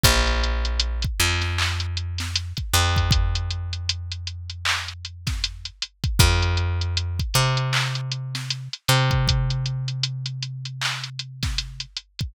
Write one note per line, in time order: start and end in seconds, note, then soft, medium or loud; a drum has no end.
0.03 1.05 A#1 medium
0.03 kick loud
0.03 closed hi-hat loud
0.27 closed hi-hat medium
0.43 closed hi-hat medium
0.65 closed hi-hat medium
0.79 closed hi-hat loud
1.02 kick medium
1.02 closed hi-hat medium
1.20 2.53 F2 medium
1.20 closed hi-hat medium
1.42 snare soft
1.42 closed hi-hat medium
1.58 clap loud
1.80 closed hi-hat medium
1.97 closed hi-hat medium
2.18 snare medium
2.18 closed hi-hat medium
2.35 closed hi-hat loud
2.57 kick medium
2.57 closed hi-hat medium
2.73 5.70 F2 medium
2.73 closed hi-hat medium
2.96 kick medium
2.96 closed hi-hat medium
3.11 kick loud
3.11 closed hi-hat loud
3.35 closed hi-hat medium
3.50 closed hi-hat medium
3.73 closed hi-hat medium
3.89 closed hi-hat loud
4.12 closed hi-hat medium
4.27 closed hi-hat medium
4.50 closed hi-hat medium
4.65 clap loud
4.88 closed hi-hat medium
5.05 closed hi-hat medium
5.27 kick medium
5.27 snare medium
5.27 closed hi-hat medium
5.44 closed hi-hat loud
5.65 closed hi-hat medium
5.82 closed hi-hat medium
6.04 kick medium
6.04 closed hi-hat medium
6.19 7.21 F2 medium
6.19 kick loud
6.19 closed hi-hat loud
6.42 closed hi-hat medium
6.57 closed hi-hat medium
6.81 closed hi-hat medium
6.97 closed hi-hat medium
7.19 kick medium
7.19 closed hi-hat medium
7.34 8.68 C3 medium
7.34 closed hi-hat medium
7.57 closed hi-hat medium
7.73 clap loud
7.95 closed hi-hat medium
8.12 closed hi-hat medium
8.35 snare medium
8.35 closed hi-hat medium
8.50 closed hi-hat medium
8.73 closed hi-hat medium
8.88 11.85 C3 medium
8.88 closed hi-hat medium
9.11 kick medium
9.11 closed hi-hat medium
9.28 kick medium
9.28 closed hi-hat loud
9.50 closed hi-hat medium
9.66 closed hi-hat medium
9.88 closed hi-hat medium
10.03 closed hi-hat loud
10.26 closed hi-hat medium
10.42 closed hi-hat medium
10.65 closed hi-hat medium
10.81 clap loud
11.04 closed hi-hat medium
11.19 closed hi-hat medium
11.43 kick medium
11.43 snare medium
11.43 closed hi-hat medium
11.58 closed hi-hat medium
11.80 closed hi-hat medium
11.96 closed hi-hat medium
12.19 kick medium
12.19 closed hi-hat medium